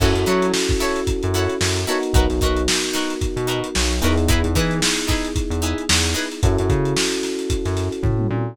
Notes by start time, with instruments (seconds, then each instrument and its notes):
0.00 synth bass 1 F#2, electric piano 1 C#4 E4 F#4 A4, acoustic guitar (steel) E4 F#4 A4 C#5, kick, crash
0.15 synth bass 1 F#2, closed hi-hat
0.26 synth bass 1 F#3, acoustic guitar (steel) E4 F#4 A4 C#5, closed hi-hat
0.42 closed hi-hat
0.54 snare
0.69 kick, closed hi-hat
0.80 acoustic guitar (steel) E4 F#4 A4 C#5, snare, closed hi-hat
0.96 closed hi-hat
1.07 kick, closed hi-hat
1.23 synth bass 1 F#2, closed hi-hat
1.34 acoustic guitar (steel) E4 F#4 A4 C#5, snare, closed hi-hat
1.49 closed hi-hat
1.61 synth bass 1 F#2, snare
1.76 closed hi-hat
1.87 electric piano 1 B3 D#4 F#4 A#4, acoustic guitar (steel) E4 F#4 A4 C#5, closed hi-hat
2.03 closed hi-hat
2.13 synth bass 1 B1, acoustic guitar (steel) D#4 F#4 A#4 B4, kick, closed hi-hat
2.30 synth bass 1 B1, snare, closed hi-hat
2.41 synth bass 1 B1, acoustic guitar (steel) D#4 F#4 A#4 B4, kick, closed hi-hat
2.57 closed hi-hat
2.68 snare
2.83 snare, closed hi-hat
2.93 acoustic guitar (steel) D#4 F#4 A#4 B4, snare, closed hi-hat
3.10 closed hi-hat
3.21 kick, closed hi-hat
3.36 synth bass 1 B2, closed hi-hat
3.47 acoustic guitar (steel) D#4 F#4 A#4 B4, closed hi-hat
3.64 closed hi-hat
3.75 synth bass 1 B1, snare
3.91 closed hi-hat
4.02 synth bass 1 E2, electric piano 1 B3 D#4 E4 G#4, acoustic guitar (steel) D#4 F#4 A#4 B4, closed hi-hat
4.18 closed hi-hat
4.28 acoustic guitar (steel) D#4 E4 G#4 B4, kick, closed hi-hat
4.44 synth bass 1 E2, closed hi-hat
4.55 synth bass 1 E3, acoustic guitar (steel) D#4 E4 G#4 B4, kick, snare, closed hi-hat
4.71 closed hi-hat
4.82 snare
4.98 closed hi-hat
5.07 acoustic guitar (steel) D#4 E4 G#4 B4, kick, snare, closed hi-hat
5.25 closed hi-hat
5.36 kick, closed hi-hat
5.50 synth bass 1 E2, closed hi-hat
5.62 acoustic guitar (steel) D#4 E4 G#4 B4, closed hi-hat
5.78 closed hi-hat
5.89 synth bass 1 E2, snare
6.05 closed hi-hat
6.14 acoustic guitar (steel) D#4 E4 G#4 B4, snare, closed hi-hat
6.32 closed hi-hat
6.43 synth bass 1 F#2, electric piano 1 C#4 E4 F#4 A4, kick, closed hi-hat
6.58 synth bass 1 F#2, closed hi-hat
6.69 synth bass 1 C#3, kick, closed hi-hat
6.85 closed hi-hat
6.97 snare
7.12 closed hi-hat
7.23 snare, closed hi-hat
7.39 closed hi-hat
7.50 kick, closed hi-hat
7.65 synth bass 1 F#2, snare, closed hi-hat
7.77 snare, closed hi-hat
7.92 closed hi-hat
8.03 synth bass 1 A2, kick, floor tom
8.19 mid tom
8.30 synth bass 1 A#2, high tom